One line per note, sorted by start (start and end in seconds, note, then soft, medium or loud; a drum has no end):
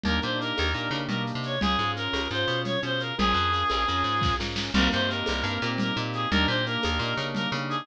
0.03 0.20 D#2 medium
0.03 0.20 A#3 medium
0.03 0.20 D4 medium
0.03 0.20 D#4 medium
0.03 0.20 G4 medium
0.03 0.19 A#4 medium
0.03 low conga medium
0.03 shaker medium
0.22 0.53 A#2 medium
0.22 0.38 A#3 medium
0.22 0.38 D4 medium
0.22 0.38 D#4 medium
0.22 0.38 G4 medium
0.22 0.38 C5 medium
0.22 shaker medium
0.39 0.71 A#3 medium
0.39 0.71 D4 medium
0.39 0.71 D#4 medium
0.39 0.71 G4 medium
0.39 0.98 A#4 medium
0.39 shaker medium
0.57 0.74 D#2 medium
0.57 tambourine medium
0.57 high conga medium
0.57 shaker medium
0.74 0.89 A#2 medium
0.74 0.90 A#3 medium
0.74 0.90 D4 medium
0.74 0.90 D#4 medium
0.74 0.90 G4 medium
0.74 shaker medium
0.91 1.07 C#3 medium
0.91 1.56 A#3 medium
0.91 1.56 D4 medium
0.91 1.56 D#4 medium
0.91 1.56 G4 medium
0.91 shaker medium
1.08 1.32 B2 medium
1.08 1.22 A#4 medium
1.08 low conga medium
1.08 shaker medium
1.27 shaker medium
1.35 1.59 C3 medium
1.43 1.59 C#5 medium
1.43 shaker medium
1.61 1.77 C#2 medium
1.61 1.78 C#4 medium
1.61 1.78 F4 medium
1.61 1.91 G#4 medium
1.61 1.78 G#4 medium
1.61 low conga loud
1.61 shaker medium
1.79 2.08 G#2 medium
1.79 1.95 C#4 medium
1.79 1.95 F4 medium
1.79 1.95 G#4 medium
1.79 shaker medium
1.96 2.28 C#4 medium
1.96 2.28 F4 medium
1.96 2.28 G#4 medium
1.96 2.28 A#4 medium
1.96 shaker medium
2.13 2.28 C#2 medium
2.13 tambourine medium
2.13 high conga medium
2.13 shaker medium
2.31 2.45 G#2 medium
2.31 2.79 C#4 medium
2.31 2.79 F4 medium
2.31 2.79 G#4 medium
2.31 2.59 C5 medium
2.31 shaker medium
2.48 2.77 B2 medium
2.48 shaker medium
2.64 2.80 C#5 medium
2.64 low conga medium
2.64 shaker medium
2.82 3.12 B2 medium
2.82 3.14 C#4 medium
2.82 3.14 F4 medium
2.82 3.14 G#4 medium
2.82 3.00 C5 medium
2.82 shaker medium
3.00 3.15 A#4 medium
3.00 shaker medium
3.18 3.34 A#1 loud
3.18 3.34 C#4 medium
3.18 3.34 F4 medium
3.18 3.34 G#4 medium
3.18 4.35 G#4 loud
3.18 3.34 A#4 medium
3.18 low conga loud
3.18 shaker medium
3.34 3.64 F2 medium
3.34 3.51 C#4 medium
3.34 3.51 F4 medium
3.34 3.51 G#4 medium
3.34 3.51 A#4 medium
3.34 shaker medium
3.52 3.84 C#4 medium
3.52 3.84 F4 medium
3.52 3.84 G#4 medium
3.52 3.84 A#4 medium
3.52 shaker medium
3.69 3.86 A#1 medium
3.69 tambourine medium
3.69 high conga medium
3.69 shaker medium
3.87 4.03 F2 medium
3.87 4.35 C#4 medium
3.87 4.35 F4 medium
3.87 4.35 G#4 medium
3.87 4.35 A#4 medium
3.87 shaker medium
4.04 4.34 G#2 medium
4.04 shaker medium
4.21 kick medium
4.21 snare medium
4.39 4.70 G#2 medium
4.39 4.71 C#4 medium
4.39 4.71 F4 medium
4.39 4.71 G#4 medium
4.39 4.71 A#4 medium
4.39 snare medium
4.56 snare medium
4.74 4.89 C2 loud
4.74 4.91 A#3 medium
4.74 4.91 C4 medium
4.74 4.91 D#4 medium
4.74 4.91 G4 medium
4.74 4.88 A#4 loud
4.74 crash loud
4.74 low conga loud
4.74 shaker medium
4.91 5.23 G2 medium
4.91 5.08 A#3 medium
4.91 5.08 C4 medium
4.91 5.08 D#4 medium
4.91 5.08 G4 medium
4.91 5.08 C5 medium
4.91 shaker medium
5.08 5.41 A#3 medium
5.08 5.41 C4 medium
5.08 5.41 D#4 medium
5.08 5.41 G4 medium
5.08 5.69 A#4 medium
5.08 shaker medium
5.26 5.43 C2 medium
5.26 tambourine medium
5.26 high conga medium
5.26 shaker medium
5.44 5.58 G2 loud
5.44 5.60 A#3 medium
5.44 5.60 C4 medium
5.44 5.60 D#4 medium
5.44 5.60 G4 medium
5.44 shaker medium
5.62 5.92 A#2 loud
5.62 5.94 A#3 medium
5.62 5.94 C4 medium
5.62 5.94 D#4 medium
5.62 5.94 G4 medium
5.62 shaker medium
5.78 5.97 A#4 medium
5.78 low conga medium
5.78 shaker medium
5.96 6.26 A#2 loud
5.96 6.28 A#3 medium
5.96 6.28 C4 medium
5.96 6.28 D#4 medium
5.96 6.28 G4 medium
5.96 shaker medium
6.13 6.29 G#4 medium
6.13 shaker medium
6.31 6.46 D#2 loud
6.31 6.47 A#3 medium
6.31 6.47 D4 medium
6.31 6.47 D#4 medium
6.31 6.47 G4 medium
6.31 6.46 A#4 loud
6.31 low conga loud
6.31 shaker medium
6.47 6.78 A#2 medium
6.47 6.64 A#3 medium
6.47 6.64 D4 medium
6.47 6.64 D#4 medium
6.47 6.64 G4 medium
6.47 6.64 C5 medium
6.47 shaker medium
6.66 6.98 A#3 medium
6.66 6.98 D4 medium
6.66 6.98 D#4 medium
6.66 6.98 G4 medium
6.66 7.27 A#4 medium
6.66 shaker medium
6.83 6.99 D#2 medium
6.83 tambourine medium
6.83 high conga medium
6.83 shaker medium
6.99 7.14 A#2 loud
6.99 7.17 A#3 medium
6.99 7.17 D4 medium
6.99 7.17 D#4 medium
6.99 7.17 G4 medium
6.99 shaker medium
7.17 7.47 C#3 medium
7.17 7.50 A#3 medium
7.17 7.50 D4 medium
7.17 7.50 D#4 medium
7.17 7.50 G4 medium
7.17 shaker medium
7.35 7.49 A#4 medium
7.35 low conga medium
7.35 shaker medium
7.52 7.82 C#3 loud
7.52 7.85 A#3 medium
7.52 7.85 D4 medium
7.52 7.85 D#4 medium
7.52 7.85 G4 medium
7.52 shaker medium
7.69 7.86 G#4 loud
7.69 shaker medium